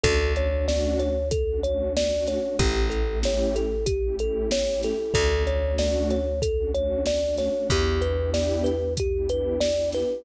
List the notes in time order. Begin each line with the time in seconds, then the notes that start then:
0.03 D2 A3 C#4 D4 F#4 A4, kick, closed hi-hat
0.20 A3 C#4 D4 F#4
0.36 A3 C#4 D4 F#4 C#5, closed hi-hat
0.51 A3 C#4 D4 F#4
0.68 D5, snare
0.99 C#5, closed hi-hat
1.31 A4, kick, closed hi-hat
1.48 A3 C#4 D4 F#4
1.63 A3 C#4 D4 F#4 C#5, closed hi-hat
1.95 A3 C#4 D4 F#4 D5, snare
2.12 A3 C#4 D4 F#4
2.26 C#5, snare, closed hi-hat
2.42 A3 C#4 D4 F#4
2.59 A1 A3 C#4 E4 G4, kick, closed hi-hat
2.75 A3 C#4 E4 G4
2.90 A3 C#4 E4 G4 A4, closed hi-hat
3.07 A3 C#4 E4 G4
3.23 C#5, snare
3.56 A4, closed hi-hat
3.86 G4, kick, closed hi-hat
4.03 A3 C#4 E4 G4
4.19 A3 C#4 E4 G4 A4, closed hi-hat
4.51 A3 C#4 E4 G4 C#5, snare
4.67 A3 C#4 E4 G4
4.82 A4, snare, closed hi-hat
4.99 A3 C#4 E4 G4
5.14 D2 A3 C#4 D4 F#4 A4, kick, closed hi-hat
5.31 A3 C#4 D4 F#4
5.47 A3 C#4 D4 F#4 C#5, closed hi-hat
5.62 A3 C#4 D4 F#4
5.78 D5, snare
6.10 C#5, closed hi-hat
6.42 A4, kick, closed hi-hat
6.57 A3 C#4 D4 F#4
6.74 A3 C#4 D4 F#4 C#5, closed hi-hat
7.06 A3 C#4 D4 F#4 D5, snare
7.23 A3 C#4 D4 F#4
7.37 C#5, snare, closed hi-hat
7.54 A3 C#4 D4 F#4
7.70 E2 B3 D4 E4 G4, kick, closed hi-hat
7.87 B3 D4 E4 G4
8.01 B3 D4 E4 G4 B4, closed hi-hat
8.17 B3 D4 E4 G4
8.34 D5, snare
8.64 B4, closed hi-hat
8.97 G4, kick, closed hi-hat
9.14 B3 D4 E4 G4
9.29 B3 D4 E4 G4 B4, closed hi-hat
9.60 B3 D4 E4 G4 D5, snare
9.77 B3 D4 E4 G4
9.92 B4, snare, closed hi-hat
10.10 B3 D4 E4 G4